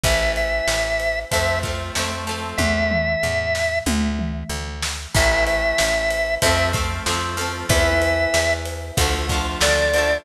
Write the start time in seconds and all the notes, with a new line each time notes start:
0.03 A1 E3 A3 E5, kick, ride
0.36 E5, ride
0.67 A1, snare
1.00 ride
1.31 F2 F3 A3 C4 E5, kick, ride
1.63 F3 A3 C4, kick, ride
1.95 F2 F3 A3, snare
1.99 C4
2.27 F3 A3, ride
2.31 C4
2.57 E2 E5, kick, high tom
2.91 mid tom
3.23 E2, floor tom
3.55 snare
3.86 D2, high tom
4.19 mid tom
4.49 D2
4.82 snare
5.14 A1 E3 A3 E5, kick, crash
5.47 E5, ride
5.78 A1, snare
6.10 ride
6.42 F2 F3 A3 E5, kick, ride
6.46 C4
6.73 F3 A3 C4, kick, ride
7.06 F2 F3 A3 C4, snare
7.37 F3 A3 C4, ride
7.69 E2 E3 B3 E5, kick, ride
8.02 ride
8.34 E2, snare
8.65 ride
8.97 D2 D3 F3 A3, kick, ride
9.29 D3 F3, kick, ride
9.34 A3
9.61 D2 D3 F3 A3 D5, snare
9.93 D3 F3, ride
9.98 A3